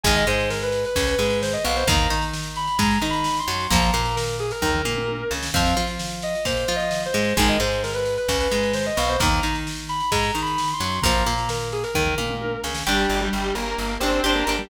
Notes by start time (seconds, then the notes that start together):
0.04 G#1 D#3 G#3 G#5, kick, ride
0.15 D#5, ride
0.26 G#2 G#3 C5, ride
0.40 ride
0.50 A#4, snare
0.62 B4, ride
0.72 ride
0.85 B4, ride
0.96 C#2 C#3, kick, ride
1.07 B4, ride
1.18 G#2 G#3, ride
1.30 ride
1.42 C5, snare
1.53 D#5, ride
1.65 B1 B2 F5, ride
1.76 C5, ride
1.87 D#2 D#3 A#3 A#5, kick, ride
1.98 ride
2.10 D#3 D#4, ride
2.22 ride
2.33 snare
2.44 ride
2.56 B5, ride
2.67 ride
2.79 G#2 G#3 A#5, kick, ride
2.91 ride
3.02 D#3 D#4, ride
3.10 B5, ride
3.24 snare
3.37 C6, ride
3.48 F#2 F#3, ride
3.60 ride
3.70 A#1 F3 A#3 A#5, kick, ride
3.81 A#5, ride
3.93 A#2 A#3, ride
4.05 ride
4.16 A#4, snare
4.28 ride
4.39 G#4, ride
4.51 A#4, ride
4.62 D#2 D#3 A#4, kick, floor tom
4.74 floor tom
4.85 A#2 A#3, mid tom
4.97 mid tom
5.08 high tom
5.31 C#2 C#3, snare
5.43 snare
5.54 F2 F3 C4 F5, kick, crash
5.66 ride
5.76 F3 F4, ride
5.87 ride
5.99 snare
6.10 ride
6.22 D#5, ride
6.35 ride
6.45 A#2 A#3 C5, kick, ride
6.57 ride
6.68 F3 F4, ride
6.76 D#5, ride
6.91 snare
7.03 C5, ride
7.14 G#2 G#3, ride
7.25 ride
7.37 G#1 D#3 G#3 G#5, kick, ride
7.48 D#5, ride
7.60 G#2 G#3 C5, ride
7.72 ride
7.83 A#4, snare
7.93 B4, ride
8.05 ride
8.17 B4, ride
8.28 C#2 C#3, kick, ride
8.40 B4, ride
8.51 G#2 G#3, ride
8.63 ride
8.73 C5, snare
8.85 D#5, ride
8.97 B1 B2 F5, ride
9.09 C5, ride
9.20 D#2 D#3 A#3 A#5, kick, ride
9.31 ride
9.43 D#3 D#4, ride
9.55 ride
9.67 snare
9.77 ride
9.89 B5, ride
10.00 ride
10.11 G#2 G#3 A#5, kick, ride
10.23 ride
10.35 D#3 D#4, ride
10.42 B5
10.46 ride
10.58 snare
10.68 ride
10.73 C6
10.80 F#2 F#3, ride
10.92 ride
11.02 A#1 F3 A#3 A#5, kick, ride
11.15 A#5, ride
11.26 A#2 A#3, ride
11.38 ride
11.49 A#4, snare
11.61 ride
11.72 G#4, ride
11.83 A#4, ride
11.94 D#2 D#3 A#4, kick, floor tom
12.06 floor tom
12.18 A#2 A#3, mid tom
12.30 mid tom
12.41 high tom
12.64 C#2 C#3, snare
12.75 snare
12.87 G1 G3 D4 G4
13.09 G1
13.21 G3 G4
13.33 G1
13.55 G1 A#3 A#4
13.78 G1
14.00 G1 C4 D4 G4 C5
14.24 G1 D4 G4
14.35 A#3 A#4
14.47 G1 D4 G4
14.59 G3 G4